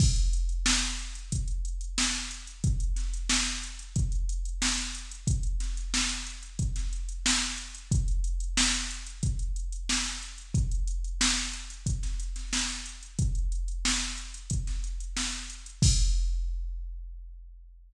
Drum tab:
CC |x---------------|----------------|----------------|----------------|
HH |-xxx-xxxxxxx-xxx|xxxx-xxxxxxx-xxx|xxxx-xxxxxxx-xxx|xxxx-xxxxxxx-xxx|
SD |----o-------o---|--o-oo------oo--|--o-o----o--o---|----o-------oo--|
BD |o-------o-------|o-------o-------|o-------o-------|o-------o-------|

CC |----------------|----------------|x---------------|
HH |xxxx-xxxxxxx-xxx|xxxx-xxxxxxx-xxx|----------------|
SD |----o----o-oo---|----o----o--o---|----------------|
BD |o-------o-------|o-------o-------|o---------------|